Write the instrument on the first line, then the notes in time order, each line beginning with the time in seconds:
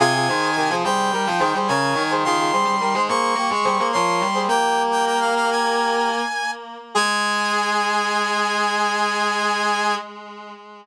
brass section
0.00 C3 F4 G#4 G#5
0.14 F4 G#4
0.28 D#3 G#4 C5
0.42 D#3
0.56 D#3 G4 A#4
0.70 F3 G#4 C5
0.84 G3 G#4 C5 G5
1.12 G3 G4 A#4
1.27 F3
1.39 D#3 G#4 C5
1.54 G3 G#4 C5
1.68 C#3 A#4 C#5 G#5
1.95 D#3
2.11 G#4 C5
2.24 D#3 F4 G#4 C6
2.38 F4 G#4
2.52 G3 G#4 C5
2.64 G3
2.80 G3 G4 A#4
2.94 G#3 G#4 C5
3.08 A#3 G#4 C5 C#6
3.35 A#3 G4 A#4
3.50 G#3
3.65 G3 G#4 C5
3.78 A#3 G#4 C5
3.93 F3 A#4 C#5 C6
4.21 G3
4.34 G#4 C5
4.48 A#3 G4 A#4 G5
4.91 G5
5.06 G5
5.20 F5
5.36 F5
5.51 G#5
6.95 G#3 G#4 G#5